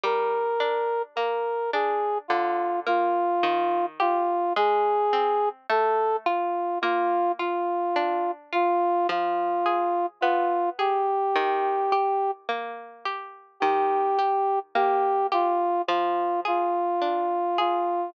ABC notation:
X:1
M:4/4
L:1/8
Q:1/4=53
K:Eb
V:1 name="Brass Section"
B2 B A F F2 F | A2 =A F F F2 F | F2 F G3 z2 | G2 G F F F2 F |]
V:2 name="Harpsichord"
G, D B, D D, B, E, G | A, C =A, F B, F D F | F, A _C A E, G B, G | E, G B, G F, A D A |]